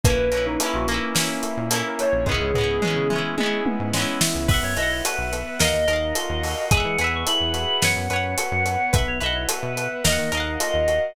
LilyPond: <<
  \new Staff \with { instrumentName = "Ocarina" } { \time 4/4 \key b \major \tempo 4 = 108 b'8 b'16 dis'16 e'16 fis'16 r4. r16 ais'16 cis''8 | gis'4. r2 r8 | r1 | r1 |
r1 | }
  \new Staff \with { instrumentName = "Electric Piano 2" } { \time 4/4 \key b \major r1 | r1 | e''16 cis''16 dis''16 cis''16 b'4 dis''4 dis''4 | gis''16 fis''16 gis''16 cis'''16 b''4 fis''4 fis''4 |
e''16 cis''16 dis''16 cis''16 b'4 dis''4 dis''4 | }
  \new Staff \with { instrumentName = "Electric Piano 1" } { \time 4/4 \key b \major ais8 cis'8 e'8 ais8 cis'8 e'8 ais8 cis'8 | gis8 b8 cis'8 e'8 gis8 b8 cis'8 e'8 | b8 e'8 fis'8 b8 ais8 dis'8 eis'8 fis'8 | gis8 b8 e'8 fis'8 b8 cis'8 fis'8 b8 |
b8 e'8 fis'8 b8 ais8 dis'8 eis'8 fis'8 | }
  \new Staff \with { instrumentName = "Acoustic Guitar (steel)" } { \time 4/4 \key b \major <ais cis' e'>8 <ais cis' e'>8 <ais cis' e'>8 <ais cis' e'>8 <ais cis' e'>4 <ais cis' e'>4 | <gis b cis' e'>8 <gis b cis' e'>8 <gis b cis' e'>8 <gis b cis' e'>8 <gis b cis' e'>4 <gis b cis' e'>4 | <b' e'' fis''>8 <b' e'' fis''>4. <ais' dis'' eis'' fis''>8 <ais' dis'' eis'' fis''>4. | <gis' b' e'' fis''>8 <gis' b' e'' fis''>4. <b' cis'' fis''>8 <b' cis'' fis''>4. |
<b' e'' fis''>8 <b' e'' fis''>4. <ais' dis'' eis'' fis''>8 <ais' dis'' eis'' fis''>4. | }
  \new Staff \with { instrumentName = "Synth Bass 1" } { \clef bass \time 4/4 \key b \major ais,,16 ais,,16 ais,,8. ais,,4. ais,4 ais,,16 | cis,16 cis,16 cis,8. cis4. gis,4 cis,16 | b,,16 fis,16 b,,8. b,,8. dis,16 dis,16 dis,8. dis,8. | e,16 e16 e,8. e,8. fis,16 fis,16 fis,8. fis,8. |
b,,16 b,,16 b,,8. b,8. dis,16 dis16 dis,8. dis,8. | }
  \new Staff \with { instrumentName = "Pad 5 (bowed)" } { \time 4/4 \key b \major <ais cis' e'>1 | <gis b cis' e'>1 | <b' e'' fis''>2 <ais' dis'' eis'' fis''>2 | <gis' b' e'' fis''>2 <b' cis'' fis''>2 |
<b' e'' fis''>2 <ais' dis'' eis'' fis''>2 | }
  \new DrumStaff \with { instrumentName = "Drums" } \drummode { \time 4/4 <hh bd>8 hh8 hh8 hh8 sn8 hh8 hh8 hh8 | <bd tomfh>8 tomfh8 toml8 toml8 tommh8 tommh8 sn8 sn8 | <cymc bd>8 hh8 hh8 hh8 sn8 hh8 hh8 hho8 | <hh bd>8 hh8 hh8 hh8 sn8 hh8 hh8 hh8 |
<hh bd>8 hh8 hh8 hh8 sn8 hh8 hh8 hh8 | }
>>